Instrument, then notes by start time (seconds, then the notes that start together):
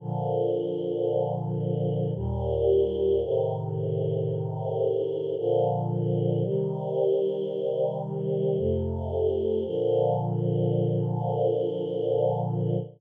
choir aahs
0.00 A#2 D3 F3
2.15 D#2 A#2 G3
3.22 A2 C3 D#3
5.37 A#2 D3 F3
6.44 C3 D#3 G3
8.57 F2 C3 A3
9.65 A#2 D3 F3